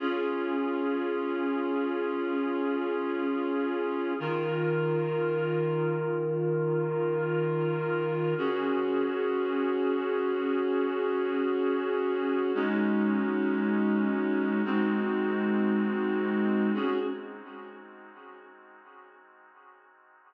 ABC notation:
X:1
M:3/4
L:1/8
Q:1/4=86
K:Dblyd
V:1 name="Clarinet"
[DFA]6- | [DFA]6 | [E,FB]6- | [E,FB]6 |
[D_GA]6- | [D_GA]6 | [A,DE_G]6 | [A,CE_G]6 |
[D_GA]2 z4 |]